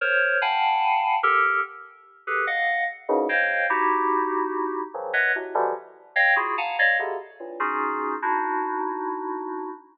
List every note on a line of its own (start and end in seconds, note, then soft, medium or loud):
0.01 0.38 A#4 medium
0.01 0.38 C5 medium
0.01 0.38 C#5 medium
0.41 1.15 F5 medium
0.41 1.15 F#5 medium
0.41 1.15 G5 medium
0.41 1.15 G#5 medium
0.41 1.15 A5 medium
0.41 1.15 B5 medium
1.23 1.60 G4 loud
1.23 1.60 A4 loud
1.23 1.60 A#4 loud
2.27 2.45 G4 medium
2.27 2.45 G#4 medium
2.27 2.45 A4 medium
2.27 2.45 B4 medium
2.47 2.84 D#5 medium
2.47 2.84 F5 medium
2.47 2.84 F#5 medium
3.09 3.27 F#2 loud
3.09 3.27 G2 loud
3.09 3.27 G#2 loud
3.09 3.27 A2 loud
3.09 3.27 B2 loud
3.09 3.27 C#3 loud
3.29 3.66 C5 medium
3.29 3.66 C#5 medium
3.29 3.66 D#5 medium
3.29 3.66 F5 medium
3.29 3.66 G5 medium
3.70 4.80 D#4 medium
3.70 4.80 E4 medium
3.70 4.80 F#4 medium
3.70 4.80 G4 medium
4.94 5.12 C#3 medium
4.94 5.12 D#3 medium
4.94 5.12 E3 medium
4.94 5.12 F3 medium
4.94 5.12 F#3 medium
5.13 5.32 B4 medium
5.13 5.32 C#5 medium
5.13 5.32 D#5 medium
5.13 5.32 E5 medium
5.13 5.32 F#5 medium
5.35 5.54 A2 medium
5.35 5.54 B2 medium
5.35 5.54 C3 medium
5.54 5.73 B2 medium
5.54 5.73 C3 medium
5.54 5.73 D3 medium
5.54 5.73 E3 medium
5.54 5.73 F3 medium
5.54 5.73 G3 medium
6.16 6.34 C#5 medium
6.16 6.34 D#5 medium
6.16 6.34 F5 medium
6.16 6.34 G5 medium
6.36 6.54 E4 medium
6.36 6.54 F4 medium
6.36 6.54 F#4 medium
6.36 6.54 G#4 medium
6.58 6.76 F5 medium
6.58 6.76 F#5 medium
6.58 6.76 G#5 medium
6.58 6.76 A5 medium
6.58 6.76 A#5 medium
6.79 6.97 C#5 medium
6.79 6.97 D5 medium
6.79 6.97 D#5 medium
6.79 6.97 F5 medium
6.99 7.17 B2 medium
6.99 7.17 C3 medium
6.99 7.17 C#3 medium
6.99 7.17 D3 medium
7.40 7.58 G2 medium
7.40 7.58 A2 medium
7.40 7.58 A#2 medium
7.60 8.15 C#4 medium
7.60 8.15 D#4 medium
7.60 8.15 F4 medium
7.60 8.15 F#4 medium
7.60 8.15 G#4 medium
8.22 9.70 D4 medium
8.22 9.70 D#4 medium
8.22 9.70 E4 medium
8.22 9.70 F#4 medium